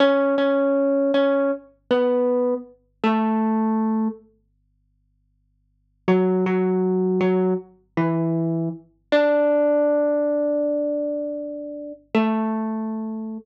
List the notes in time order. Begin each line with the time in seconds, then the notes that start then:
0.00 C#4 C#5
0.38 C#4 C#5
1.14 C#4 C#5
1.91 B3 B4
3.04 A3 A4
6.08 F#3 F#4
6.46 F#3 F#4
7.21 F#3 F#4
7.97 E3 E4
9.12 D4 D5
12.15 A3 A4